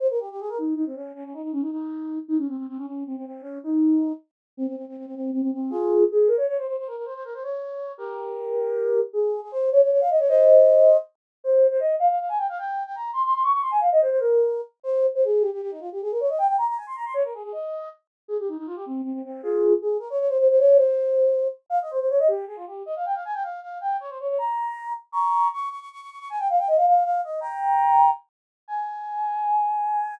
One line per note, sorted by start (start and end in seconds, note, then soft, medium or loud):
0.00 0.08 C5 loud
0.10 0.19 A#4 loud
0.20 0.29 G4 medium
0.31 0.40 G4 loud
0.40 0.49 G#4 loud
0.49 0.58 A#4 loud
0.58 0.74 D#4 medium
0.76 0.85 D#4 loud
0.86 0.95 C4 loud
0.95 1.12 C#4 loud
1.15 1.24 C#4 loud
1.24 1.33 C#4 loud
1.34 1.42 D#4 loud
1.43 1.52 D#4 medium
1.52 1.62 C#4 loud
1.61 1.70 D#4 medium
1.71 2.19 D#4 loud
2.28 2.37 D#4 loud
2.38 2.47 C#4 loud
2.48 2.57 C4 loud
2.57 2.66 C4 medium
2.68 2.77 C4 loud
2.77 2.86 C#4 loud
2.86 3.04 C#4 medium
3.07 3.16 C4 medium
3.17 3.25 C4 loud
3.26 3.41 C4 loud
3.41 3.58 C#4 loud
3.63 4.12 D#4 loud
4.57 4.66 C4 loud
4.67 4.76 C4 loud
4.76 4.85 C4 medium
4.88 4.97 C4 medium
4.97 5.06 C4 medium
5.06 5.15 C4 loud
5.15 5.31 C4 loud
5.33 5.41 C4 loud
5.42 5.51 C4 loud
5.53 5.71 C4 medium
5.70 6.04 F4 loud
5.70 6.04 G#4 loud
6.12 6.29 G#4 loud
6.28 6.37 A#4 loud
6.37 6.46 C#5 medium
6.48 6.57 C#5 loud
6.58 6.67 C5 medium
6.67 6.76 C5 loud
6.78 6.87 C5 loud
6.87 6.96 A#4 loud
6.96 7.05 A#4 medium
7.05 7.14 C5 loud
7.14 7.23 C5 loud
7.25 7.34 A#4 loud
7.34 7.43 C5 loud
7.43 7.92 C#5 loud
7.98 9.00 G4 medium
7.98 9.00 A#4 loud
9.13 9.40 G#4 loud
9.42 9.51 G#4 medium
9.52 9.70 C5 loud
9.72 9.81 C#5 loud
9.83 9.91 C#5 medium
9.92 10.01 C#5 loud
10.01 10.10 F5 loud
10.10 10.19 D#5 medium
10.19 10.28 C#5 loud
10.28 10.97 C5 loud
10.28 10.97 D#5 loud
11.44 11.67 C5 loud
11.71 11.80 C5 loud
11.80 11.95 D#5 loud
11.99 12.08 F5 loud
12.10 12.19 F5 loud
12.20 12.29 F5 medium
12.29 12.38 G#5 loud
12.38 12.47 G5 loud
12.49 12.58 F5 loud
12.58 12.83 G5 loud
12.86 12.95 G5 loud
12.95 13.11 A#5 loud
13.13 13.22 C6 loud
13.25 13.33 C6 loud
13.34 13.43 C6 loud
13.44 13.52 C#6 loud
13.53 13.62 C#6 loud
13.62 13.71 C6 loud
13.71 13.80 G#5 loud
13.80 13.89 F5 loud
13.92 14.01 D#5 loud
14.01 14.10 C5 loud
14.10 14.19 C5 loud
14.20 14.61 A#4 loud
14.83 15.06 C5 loud
15.15 15.24 C5 loud
15.25 15.43 G#4 loud
15.41 15.50 G4 loud
15.53 15.61 G4 medium
15.62 15.71 G4 loud
15.71 15.80 D#4 loud
15.80 15.89 F4 loud
15.92 16.01 G4 medium
16.02 16.11 G#4 loud
16.11 16.20 A#4 loud
16.20 16.29 C#5 loud
16.29 16.38 D#5 medium
16.38 16.47 G5 loud
16.47 16.56 G5 loud
16.58 16.67 A#5 loud
16.68 16.77 A#5 loud
16.77 16.86 G#5 loud
16.87 16.96 C6 loud
16.96 17.05 A#5 loud
17.05 17.14 C6 loud
17.14 17.23 C#5 loud
17.24 17.33 A#4 medium
17.34 17.43 G#4 loud
17.43 17.52 G#4 loud
17.52 17.89 D#5 loud
18.28 18.37 G#4 loud
18.39 18.48 G4 loud
18.48 18.57 D#4 medium
18.57 18.67 D#4 loud
18.67 18.76 F4 loud
18.76 18.85 G4 loud
18.86 19.01 C4 loud
19.03 19.13 C4 loud
19.13 19.22 C4 loud
19.25 19.41 C4 loud
19.43 19.73 F4 loud
19.43 19.73 G#4 loud
19.82 19.97 G#4 loud
19.99 20.08 A#4 loud
20.10 20.19 C#5 loud
20.19 20.28 C#5 loud
20.29 20.38 C5 loud
20.39 20.48 C5 loud
20.50 20.59 C5 loud
20.59 20.77 C#5 loud
20.77 21.48 C5 medium
21.70 21.79 F5 loud
21.82 21.91 D#5 medium
21.91 21.99 C5 loud
22.00 22.09 C5 loud
22.10 22.19 C#5 loud
22.19 22.28 D#5 loud
22.28 22.45 G4 loud
22.47 22.56 G#4 loud
22.56 22.65 F4 loud
22.67 22.83 G4 medium
22.86 22.95 D#5 loud
22.96 23.05 F5 loud
23.06 23.15 G5 loud
23.15 23.24 F5 medium
23.25 23.34 G#5 loud
23.34 23.43 G5 loud
23.43 23.60 F5 loud
23.62 23.78 F5 loud
23.81 23.97 G5 loud
24.00 24.09 C#5 loud
24.09 24.18 C5 medium
24.20 24.28 C#5 loud
24.29 24.38 C#5 loud
24.38 24.93 A#5 loud
25.12 25.48 A#5 loud
25.12 25.48 C#6 loud
25.53 25.69 C#6 loud
25.70 25.79 C#6 loud
25.80 25.89 C#6 loud
25.92 26.01 C#6 loud
26.01 26.10 C#6 loud
26.10 26.19 C#6 medium
26.19 26.28 C#6 loud
26.30 26.39 G#5 loud
26.39 26.48 G5 loud
26.50 26.59 F5 loud
26.59 26.68 G5 loud
26.68 26.77 D#5 loud
26.77 26.86 F5 loud
26.87 27.03 F5 medium
27.05 27.21 F5 loud
27.24 27.40 D#5 loud
27.41 28.10 G5 loud
27.41 28.10 A#5 loud
28.68 30.15 G#5 loud